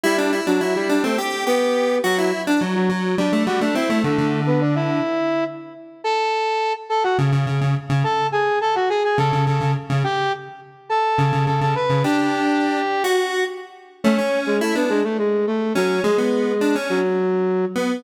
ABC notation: X:1
M:7/8
L:1/16
Q:1/4=105
K:Dmix
V:1 name="Flute"
[G,G]3 [F,F] [F,F] [G,G]2 [A,A] z2 [B,B]4 | [F,F]2 z3 [F,F] z2 [Dd]2 [Ff] [Dd] [Ee]2 | [A,A]3 [B,B] [Dd] [Ee]5 z4 | [K:Amix] [Aa]6 [Aa] [Ff] z6 |
[Aa]2 [^G^g]2 [Aa] [Ff] [Gg] [Gg] [Aa]2 [Aa]2 z2 | [Gg]2 z4 [Aa]4 [Aa] [Aa] [Bb]2 | [Gg]8 z6 | [Cc]3 [^G,^G] [A,A] [B,B] [G,G] [A,A] [G,G]2 [A,A]2 [F,F]2 |
[^G,^G]6 [F,F]6 z2 |]
V:2 name="Lead 1 (square)"
E D E D E2 D C G2 G4 | F E2 D F,2 F,2 G, A, G, A, C A, | D, D,7 z6 | [K:Amix] z8 C, C, C, C, z C, |
z8 C, C, C, C, z C, | z8 C, C, C, C, z C, | D6 z F3 z4 | A, C3 E D2 z5 C2 |
^G, B,3 D C2 z5 B,2 |]